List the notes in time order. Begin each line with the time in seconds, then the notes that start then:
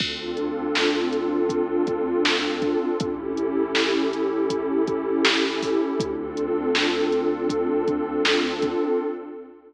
0.00 D2 C4 D4 F4 A4, kick, crash
0.37 closed hi-hat
0.75 snare
1.13 closed hi-hat
1.49 kick, closed hi-hat
1.87 kick, closed hi-hat
2.25 snare
2.62 kick, closed hi-hat
3.00 A1 C#4 E4 G4 A4, kick, closed hi-hat
3.37 closed hi-hat
3.75 snare
4.13 closed hi-hat
4.50 kick, closed hi-hat
4.87 kick, closed hi-hat
5.25 snare
5.62 kick, open hi-hat
5.99 D2 C4 D4 F4 A4, kick, closed hi-hat
6.37 closed hi-hat
6.75 snare
7.12 closed hi-hat
7.50 kick, closed hi-hat
7.88 kick, closed hi-hat
8.25 snare
8.62 kick, closed hi-hat